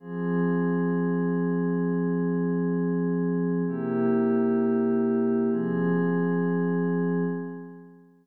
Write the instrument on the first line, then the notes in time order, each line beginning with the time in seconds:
pad 5 (bowed)
0.00 F3 C4 G#4
3.67 C3 A#3 E4 G4
5.50 F3 C4 G#4